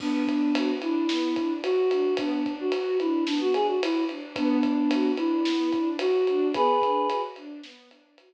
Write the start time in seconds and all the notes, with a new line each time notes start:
0.00 B3 D4, kick, crash
0.27 D4, kick, ride
0.55 F#4, ride
0.82 D4 E4, ride
1.09 B3, snare
1.36 D4, kick, ride
1.63 F#4, ride
1.91 D4, ride
2.17 B3 D4, kick, ride
2.45 D4, kick, ride
2.60 F#4
2.72 F#4, ride
3.00 D4 E4, ride
3.26 B3 D4, snare
3.41 F#4
3.54 D4 G#4, ride
3.68 F#4
3.82 E4 F#4, ride
4.09 D4, ride
4.36 B3 D4, kick, ride
4.63 D4, kick, ride
4.91 F#4, ride
5.17 D4 E4, ride
5.45 B3, snare
5.73 D4, kick, ride
5.99 F#4, ride
6.27 D4, ride
6.54 B3 G#4 B4, kick, ride
6.82 D4, kick, ride
7.09 F#4, ride
7.36 D4, ride
7.63 B3, snare
7.91 D4, ride
8.18 F#4, ride